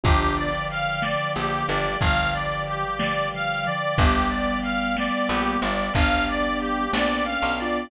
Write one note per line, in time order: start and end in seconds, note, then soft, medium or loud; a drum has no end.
0.04 1.16 G1 medium
0.04 1.87 D3 medium
0.04 1.87 F3 medium
0.04 0.50 B3 medium
0.04 0.50 D4 medium
0.04 0.50 F4 medium
0.04 0.50 G4 medium
0.04 0.34 G4 medium
0.04 3.94 B4 medium
0.04 3.94 D5 medium
0.04 3.94 F5 medium
0.04 3.94 G5 medium
0.04 kick loud
0.04 closed hi-hat medium
0.37 0.67 D5 medium
0.70 1.00 F5 medium
0.70 closed hi-hat medium
1.02 1.32 D5 medium
1.02 snare medium
1.36 1.64 A#1 medium
1.36 1.64 A#3 medium
1.36 1.66 G4 medium
1.68 1.96 G1 medium
1.68 1.97 G3 medium
1.68 1.99 D5 medium
1.68 closed hi-hat medium
2.01 3.69 G1 medium
2.01 2.84 D3 medium
2.01 2.84 F3 medium
2.01 3.69 G3 medium
2.01 2.31 F5 medium
2.01 kick medium
2.01 closed hi-hat medium
2.33 2.64 D5 medium
2.67 2.97 G4 medium
2.67 closed hi-hat medium
2.98 3.28 D3 medium
2.98 3.28 F3 medium
2.98 3.29 D5 medium
2.98 snare loud
3.33 3.64 D3 medium
3.33 3.64 F3 medium
3.33 3.64 F5 medium
3.64 3.97 D3 medium
3.64 3.97 F3 medium
3.64 3.95 D5 medium
3.64 closed hi-hat medium
3.98 5.10 G1 medium
3.98 5.62 G3 medium
3.98 5.62 B3 medium
3.98 4.28 G4 medium
3.98 7.88 B4 medium
3.98 7.88 D5 medium
3.98 7.88 F5 medium
3.98 7.88 G5 medium
3.98 kick medium
3.98 closed hi-hat medium
4.30 4.60 D5 medium
4.63 4.93 F5 medium
4.63 closed hi-hat medium
4.96 5.27 D5 medium
4.96 snare loud
5.29 5.57 A#1 medium
5.29 5.58 A#3 medium
5.29 5.60 G4 medium
5.62 5.90 G1 medium
5.62 5.90 G3 medium
5.62 5.93 D5 medium
5.62 closed hi-hat medium
5.94 6.88 G1 medium
5.94 6.88 G3 medium
5.94 6.85 B3 medium
5.94 6.85 D4 medium
5.94 6.25 F5 medium
5.94 kick medium
5.94 closed hi-hat loud
6.28 6.58 D5 medium
6.60 6.91 G4 medium
6.60 closed hi-hat medium
6.92 7.37 A#1 medium
6.92 7.37 A#3 medium
6.92 7.23 B3 medium
6.92 7.23 D4 medium
6.92 7.24 D5 medium
6.92 snare loud
7.25 7.53 C#4 medium
7.25 7.55 F5 medium
7.42 7.87 B1 medium
7.42 7.86 B3 medium
7.58 7.90 D4 medium
7.58 7.90 F4 medium
7.58 7.89 D5 medium
7.58 closed hi-hat medium